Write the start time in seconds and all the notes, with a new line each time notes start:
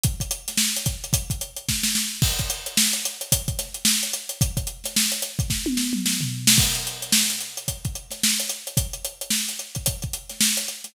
0.03 kick, closed hi-hat
0.20 kick, closed hi-hat
0.31 closed hi-hat
0.48 snare, closed hi-hat
0.57 snare
0.76 closed hi-hat
0.86 kick, closed hi-hat
1.04 closed hi-hat
1.13 kick, closed hi-hat
1.30 kick, closed hi-hat
1.41 closed hi-hat
1.56 closed hi-hat
1.69 kick, snare
1.83 snare
1.95 snare
2.22 kick, crash
2.39 kick, closed hi-hat
2.50 closed hi-hat
2.66 closed hi-hat
2.77 snare
2.93 closed hi-hat
3.05 closed hi-hat
3.21 closed hi-hat
3.32 kick, closed hi-hat
3.48 kick, closed hi-hat
3.59 snare, closed hi-hat
3.74 closed hi-hat
3.85 snare
4.03 closed hi-hat
4.13 closed hi-hat
4.29 closed hi-hat
4.41 kick, closed hi-hat
4.57 kick, closed hi-hat
4.67 closed hi-hat
4.84 snare, closed hi-hat
4.96 snare
5.12 closed hi-hat
5.22 closed hi-hat
5.39 kick, closed hi-hat
5.50 kick, snare
5.66 high tom
5.77 snare
5.93 mid tom
6.06 snare
6.21 floor tom
6.47 snare
6.58 kick, crash
6.75 closed hi-hat
6.87 closed hi-hat
7.02 closed hi-hat
7.12 snare
7.30 snare, closed hi-hat
7.41 closed hi-hat
7.57 closed hi-hat
7.68 kick, closed hi-hat
7.85 kick, closed hi-hat
7.95 closed hi-hat
8.10 snare, closed hi-hat
8.23 snare
8.40 closed hi-hat
8.49 closed hi-hat
8.67 closed hi-hat
8.77 kick, closed hi-hat
8.93 closed hi-hat
9.05 closed hi-hat
9.21 closed hi-hat
9.30 snare
9.49 closed hi-hat
9.59 closed hi-hat
9.75 kick, closed hi-hat
9.86 kick, closed hi-hat
10.02 kick, closed hi-hat
10.13 closed hi-hat
10.29 snare, closed hi-hat
10.41 snare
10.57 closed hi-hat
10.68 closed hi-hat
10.84 snare, closed hi-hat